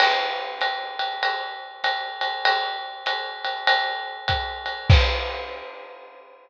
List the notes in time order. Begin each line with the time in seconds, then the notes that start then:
0.00 crash, ride
0.61 hi-hat pedal, ride
0.99 ride
1.23 ride
1.84 hi-hat pedal, ride
2.21 ride
2.45 ride
3.06 hi-hat pedal, ride
3.45 ride
3.67 ride
4.28 kick, hi-hat pedal, ride
4.66 ride
4.90 kick, crash